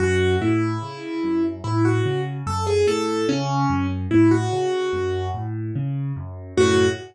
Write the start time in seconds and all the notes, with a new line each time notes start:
0.00 F#2 F#4
0.41 A2 E4
0.82 C#3
1.23 F#2
1.64 A2 E4
1.85 F#4
2.05 C#3
2.47 F#2 A4
2.67 G#4
2.87 A2 A4
3.28 C#3 C#4
3.70 F#2
4.11 A2 E4
4.31 F#4
4.52 C#3
4.93 F#2
5.34 A2
5.76 C#3
6.16 F#2
6.57 F#2 A2 C#3 F#4